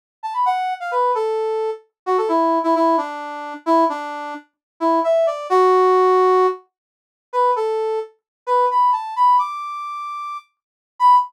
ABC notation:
X:1
M:4/4
L:1/16
Q:1/4=131
K:B
V:1 name="Brass Section"
z2 =a b f3 =f B2 =A6 | z2 F =A E3 E E2 =D6 | E2 =D4 z4 E2 e2 =d2 | F10 z6 |
B2 =A4 z4 B2 b2 =a2 | b2 =d'10 z4 | b4 z12 |]